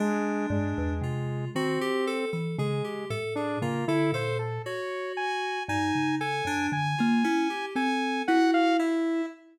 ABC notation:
X:1
M:9/8
L:1/16
Q:3/8=39
K:none
V:1 name="Kalimba"
z2 G,, E,, C,2 _E, z2 =E, _D, z A,,2 D, =D, _B,,2 | z4 G,, _D,2 _G,, =D, _B, E z C2 E4 |]
V:2 name="Lead 2 (sawtooth)"
_A,2 A,4 C3 z A,2 z D _B, E c =A | _d2 _a2 a2 a2 a4 a2 _g f e2 |]
V:3 name="Electric Piano 2"
D4 F2 _G =G A A _A G =A _A F =A A z | _G4 _E2 A D z F _D =G A2 _G2 =E2 |]